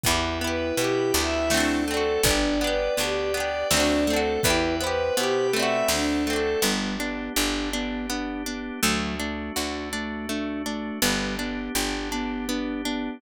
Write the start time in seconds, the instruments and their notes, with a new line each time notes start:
0.04 electric bass (finger) E2, pizzicato strings B3, ocarina E4, violin E4, drawbar organ B4 E5 G5, kick, closed hi-hat
0.08 pizzicato strings E4 G4
0.41 pizzicato strings B3 E4, violin B4
0.47 pizzicato strings G4
0.77 electric bass (finger) B2, pizzicato strings B3 E4, violin G4, drawbar organ B4 G5 B5, closed hi-hat
0.84 pizzicato strings G4
1.14 electric bass (finger) D2, pizzicato strings B3 E4, violin E5
1.21 pizzicato strings G4
1.50 pizzicato strings A3, violin D4, drawbar organ A4 C5 D5 F#5, snare
1.54 pizzicato strings C4 D4
1.60 pizzicato strings F#4
1.87 pizzicato strings A3 C4, violin A4
1.94 pizzicato strings D4 F#4
2.23 electric bass (finger) G1, pizzicato strings B3, violin D4, drawbar organ B4 D5 G5, ocarina D5, kick, closed hi-hat
2.27 pizzicato strings D4 G4
2.60 pizzicato strings B3 D4, violin B4
2.67 pizzicato strings G4
2.97 electric bass (finger) D2, pizzicato strings B3 D4, drawbar organ G4 B4 G5, violin G4, closed hi-hat
3.03 pizzicato strings G4
3.34 pizzicato strings B3 D4, violin D5
3.40 pizzicato strings G4
3.71 electric bass (finger) D2, pizzicato strings A3 C4, violin D4, drawbar organ A4 C5 D5 F#5, snare
3.77 pizzicato strings D4 F#4
4.07 pizzicato strings A3 C4, violin A4
4.13 pizzicato strings D4 F#4
4.43 electric bass (finger) E2, pizzicato strings B3 E4, violin E4, ocarina B4, drawbar organ B4 E5 G5, kick, closed hi-hat
4.50 pizzicato strings G4
4.80 pizzicato strings B3 E4, violin B4, ocarina C5
4.87 pizzicato strings G4
5.17 electric bass (finger) B2, pizzicato strings B3 E4, violin G4, drawbar organ B4 G5 B5, closed hi-hat
5.23 pizzicato strings G4
5.53 pizzicato strings A3 C4, violin E5
5.59 pizzicato strings D4 F#4
5.88 electric bass (finger) D2, violin D4, drawbar organ A4 C5 D5 F#5, snare
6.26 pizzicato strings A3 C4, violin A4
6.33 pizzicato strings D4 F#4
6.62 electric bass (finger) G1, ocarina G3, pizzicato strings B3, drawbar organ B3 D4 G4
7.00 ocarina B3, pizzicato strings D4
7.36 electric bass (finger) G1, ocarina D4, pizzicato strings G4
7.73 ocarina B3, pizzicato strings D4
8.09 pizzicato strings B3, ocarina D4
8.46 ocarina B3, pizzicato strings D4
8.83 electric bass (finger) D2, ocarina F#3, pizzicato strings A3, drawbar organ A3 D4 F#4
9.19 ocarina A3, pizzicato strings D4
9.56 electric bass (finger) D2, ocarina D4, pizzicato strings F#4
9.93 ocarina A3, pizzicato strings D4
10.29 pizzicato strings A3, ocarina D4
10.65 ocarina A3, pizzicato strings D4
11.02 electric bass (finger) G1, ocarina G3, pizzicato strings B3, drawbar organ B3 D4 G4
11.39 ocarina B3, pizzicato strings D4
11.75 electric bass (finger) G1, ocarina D4, pizzicato strings G4
12.12 ocarina B3, pizzicato strings D4
12.48 pizzicato strings B3, ocarina D4
12.85 ocarina B3, pizzicato strings D4